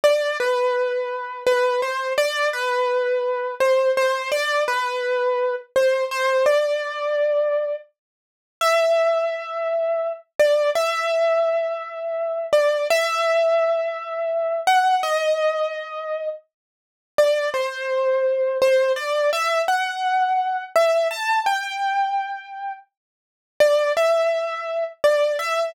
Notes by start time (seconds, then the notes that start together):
0.04 D5
0.40 B4
1.46 B4
1.82 C5
2.18 D5
2.53 B4
3.60 C5
3.97 C5
4.32 D5
4.68 B4
5.76 C5
6.11 C5
6.46 D5
8.61 E5
10.39 D5
10.75 E5
12.53 D5
12.90 E5
14.67 F#5
15.03 D#5
17.18 D5
17.54 C5
18.62 C5
18.96 D5
19.33 E5
19.68 F#5
20.76 E5
21.11 A5
21.46 G5
23.60 D5
23.97 E5
25.04 D5
25.39 E5